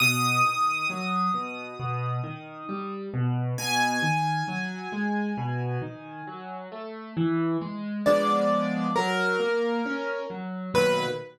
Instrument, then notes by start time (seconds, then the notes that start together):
acoustic grand piano
0.00 B2 D#6
0.45 D#3
0.90 F#3
1.34 B2
1.79 B2
2.24 D#3
2.69 G3
3.14 B2
3.58 B2 G#5
4.02 D#3
4.48 F#3
4.92 G#3
5.37 B2
5.82 D#3
6.27 F#3
6.72 A3
7.17 E3
7.61 G#3
8.06 F3 G#3 B3 D4 D5
8.96 F#3 A#4
9.40 A#3
9.86 C#4
10.30 F#3
10.74 B1 A#2 D#3 F#3 B4